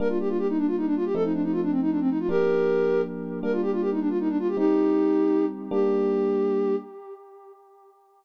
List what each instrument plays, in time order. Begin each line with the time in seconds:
0.00 electric piano 1 G3 A#3 D4, flute A#4
0.09 flute F4
0.20 flute G4
0.29 flute F4
0.38 flute G4
0.48 flute D#4
0.58 flute D4
0.67 flute F4
0.77 flute D#4
0.86 flute D4
0.96 flute F4
1.05 flute G4
1.15 electric piano 1 F3 A3 C4 D#4, flute A4
1.24 flute D#4
1.33 flute D4
1.43 flute D#4
1.52 flute F4
1.62 flute D4
1.71 flute C4
1.82 flute D#4
1.90 flute D4
2.00 flute C4
2.09 flute D#4
2.19 flute F4
2.29 electric piano 1 F3 A#3 D4, flute G4 A#4
3.43 electric piano 1 G3 A#3 D4, flute A#4
3.52 flute F4
3.62 flute G4
3.72 flute F4
3.81 flute G4
3.91 flute D#4
4.00 flute D4
4.09 flute F4
4.20 flute D#4
4.29 flute D4
4.39 flute F4
4.48 flute G4
4.57 electric piano 1 G3 C4 D#4, flute D#4 G4
5.71 electric piano 1 G3 A#3 D4, flute G4